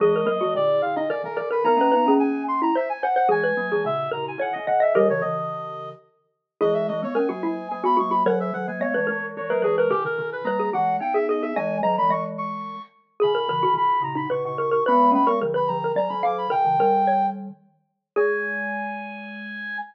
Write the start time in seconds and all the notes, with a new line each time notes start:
0.00 E3 G#3 G#4 D#5
0.16 A#4
0.26 F#3 A#3 A#4
0.41 E3 G#3 F#4
0.55 A#2 D3 D5
0.82 A#2 D3 F5
0.96 D#4 D#5
1.09 B2 D#3 A#4 D5
1.24 B2 D#3 A#4
1.36 B2 D#3 A#4 D5
1.51 A#4 B4
1.64 B3 D#4 A#4 A#5
1.77 A#3 C#4
1.81 B4
1.92 B3 D#4 B4
2.06 A#3 C#4 G#4
2.19 G#5
2.48 C6
2.62 E4 A#5
2.75 C5 E5
2.89 G#5
3.03 C5 F#5
3.16 C5 F#5
3.28 E3 G#3 G#4 G#5
3.44 B4
3.57 F#3 A#3
3.72 E3 G#3 G#4
3.85 A#2 C#3 E5
4.11 A#2 C#3 A#4 A#5
4.28 G#5
4.38 B2 D#3 C#5 F#5
4.53 B2 D#3 D#5
4.67 B2 D#3 D#5 F#5
4.80 D#5 E5
4.95 D#3 G3 G4 A#4 D#5
5.10 C#3 E3 C#5
5.21 C#3 E3 D#5
6.61 E3 G#3 E4 G#4 D#5
6.74 E5
6.88 E3 G#3 D#5
7.03 G#3 B3 C#5
7.15 A#3 C#4 A#4 G#5
7.29 F#3 A#3 F#4
7.43 F#3 A#3 E4
7.70 F#3 A#3 G#5
7.84 G#3 B3 F#4 B5
7.97 F#3 A#3 F#4 C#6
8.10 F#4 B5
8.26 D#3 F#3 A#4 C#5 F#5
8.40 E5
8.53 D#3 F#3 F#5
8.68 F#3 A#3 G#5
8.80 G#3 B3 C#5 D#5
8.94 E3 G#3 B4
9.07 E3 G#3 A#4
9.37 E3 G#3 C#5
9.49 F#3 A#3 A#4 B4
9.62 E3 G#3 G#4 B4
9.78 A#4 B4
9.91 B2 D#3 G4 A#4
10.05 B2 D#3 A#4
10.18 B2 D#3
10.32 B4
10.44 G3 A#3 B4 A#5
10.60 G#4
10.73 E3 G#3 G4 F#5
11.00 B3 D#4 G5
11.14 G#4 E5
11.29 G#4 D#5
11.42 G#4 E5
11.56 E3 G#3 D#5 G#5
11.83 D#3 F#3 D#5 A#5
11.98 E3 G#3 B5
12.09 E3 G#3 D#5 C#6
12.38 C#6
13.20 B2 D#3 G#4 B5
13.35 A#4
13.48 C#3 E3 A#4
13.63 B2 D#3 F#4
13.74 B2 D#3 B5
14.02 A#2 C#3 A#5
14.15 D#4 B5
14.30 A#2 C#3 B4 C#6
14.45 A#2 C#3 C#6
14.58 A#2 C#3 A#4 C#6
14.71 A#4 C#6
14.86 G#3 B3 B4 B5
15.11 A#3 C#4 B5
15.26 G#3 B3 A#4 C#6
15.42 D3 F3 A#4
15.54 B4 B5
15.68 D3 F3 A#5
15.84 A#4
15.96 D#3 F#3 D5 A#5
16.09 D#3 F#3 B5
16.23 D#3 F#3 F5 D6
16.38 B5
16.50 B2 D#3 A#4 G5
16.65 C#3 E3
16.79 D#3 G3 A#4
17.07 C#5
18.16 G#3 G#4 G#5